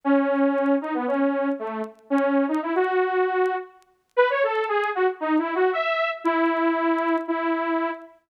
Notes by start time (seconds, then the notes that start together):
0.04 C#4
0.81 D#4
0.94 B3
1.07 C#4
1.59 A3
2.10 C#4
2.48 D#4
2.62 E4
2.75 F#4
4.16 B4
4.30 C#5
4.43 A4
4.68 G#4
4.95 F#4
5.20 D#4
5.38 E4
5.55 F#4
5.73 E5
6.24 E4
7.28 E4